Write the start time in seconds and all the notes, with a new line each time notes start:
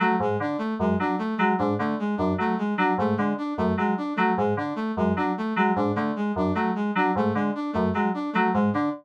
0.00 F#3 A3
0.20 G#2 G#3
0.40 D3 D4
0.58 A3
0.79 F#2 G#3
1.00 F#3 D4
1.19 A3
1.37 F#3 G#3
1.58 G#2 D4
1.79 D3 A3
1.99 G#3
2.17 F#2 D4
2.38 F#3 A3
2.58 G#3
2.77 F#3 D4
2.98 G#2 A3
3.17 D3 G#3
3.38 D4
3.58 F#2 A3
3.77 F#3 G#3
3.98 D4
4.16 F#3 A3
4.37 G#2 G#3
4.57 D3 D4
4.76 A3
4.97 F#2 G#3
5.16 F#3 D4
5.38 A3
5.56 F#3 G#3
5.76 G#2 D4
5.95 D3 A3
6.16 G#3
6.36 F#2 D4
6.55 F#3 A3
6.75 G#3
6.95 F#3 D4
7.15 G#2 A3
7.35 D3 G#3
7.55 D4
7.73 F#2 A3
7.93 F#3 G#3
8.14 D4
8.33 F#3 A3
8.54 G#2 G#3
8.73 D3 D4